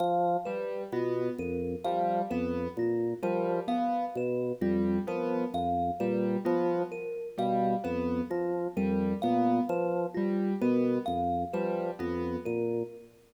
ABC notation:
X:1
M:2/4
L:1/8
Q:1/4=65
K:none
V:1 name="Drawbar Organ" clef=bass
F, z B,, F,, | F, F,, _B,, F, | z B,, F,, F, | F,, _B,, F, z |
B,, F,, F, F,, | _B,, F, z =B,, | F,, F, F,, _B,, |]
V:2 name="Acoustic Grand Piano"
z G, B, z | G, B, z G, | B, z G, B, | z G, B, z |
G, B, z G, | B, z G, B, | z G, B, z |]
V:3 name="Kalimba"
f B F _B | f B F _B | f B F _B | f B F _B |
f B F _B | f B F _B | f B F _B |]